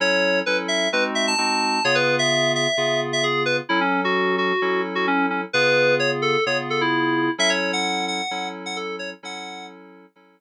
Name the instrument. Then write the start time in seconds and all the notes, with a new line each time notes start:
electric piano 2
0.00 F#3 C#4 E4 A4 C#5
0.46 F#3 C#4 E4 A4 B4
0.68 E5
0.92 G#3 C4 D#4 F#4 B4
1.15 E5
1.27 A5
1.38 G#3 C4 D#4 F#4
1.84 C#3 B3 F4 G#4 C#5
1.95 B4
2.19 E5
2.55 E5
2.77 C#3 B3 F4 G#4
3.13 E5
3.23 G#4
3.45 B4
3.69 F#3 C#4 E4 A4
3.81 C#4
4.04 F#4
4.38 F#4
4.62 F#3 C#4 E4 A4
4.95 F#4
5.07 C#4
5.30 C#4
5.53 C#3 B3 F4 G#4 B4
6.00 C#5
6.22 A4
6.46 C#3 B3 F4 G#4 C#5
6.70 A4
6.81 E4
7.38 F#3 C#4 E4 A4 E5
7.50 C#5
7.73 F#5
8.08 F#5
8.31 F#3 C#4 E4 A4
8.66 F#5
8.76 A4
8.99 C#5
9.23 F#3 C#4 E4 A4 F#5
10.16 F#3 C#4 E4 A4